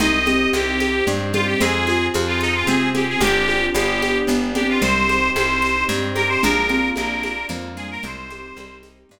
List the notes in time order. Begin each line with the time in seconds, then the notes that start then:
0.00 C2 C4 D#4 G4 D#5, low conga, shaker
0.26 C4 G4, high conga, shaker
0.53 C2 C4 G4, high conga, shaker
0.80 D#4, high conga, shaker
1.07 G2 G3 C4, low conga, shaker
1.33 G3 F4 G4, high conga, shaker
1.47 G4
1.60 F2 C4 F4 G#4, low conga, shaker
1.87 F4 G#4, high conga, shaker
2.14 F2 C4, high conga, shaker
2.27 F4
2.41 D#4 F4, shaker
2.55 F4
2.67 C3 C4 G#4, low conga, shaker
2.94 C4 G4 G#4, high conga, shaker
3.09 G#4
3.21 G1 C4 D4 G4, low conga, shaker
3.27 G4
3.48 F4, high conga, shaker
3.74 G1 B3 D4 G4, high conga, shaker
4.02 G4, high conga, shaker
4.27 G1 B3, low conga, shaker
4.55 C4 D4 G4, high conga, shaker
4.69 F4
4.82 C2 G3 C4 D#4 G4 C5, low conga, shaker
5.09 G4, high conga, shaker
5.35 C2 C4 C5, high conga, shaker
5.62 D#4, shaker
5.89 G2 C4, low conga, shaker
6.15 G4 A#4, high conga, shaker
6.29 C5
6.42 A#1 A#3 D4 F4 A#4, low conga, shaker
6.69 C4 F4, high conga, shaker
6.96 A#1 A#3 A#4, high conga, shaker
7.23 D4, high conga, shaker
7.49 F2 F3 A#3, low conga, shaker
7.77 G3 F4 G#4, shaker
7.91 A#4
8.02 C2 G3 C4 D#4 G4 C5, low conga, shaker
8.30 G4, high conga, shaker
8.57 C2 G3 C4, high conga, shaker
8.83 D#4, high conga, shaker
9.09 G2 C4, low conga, shaker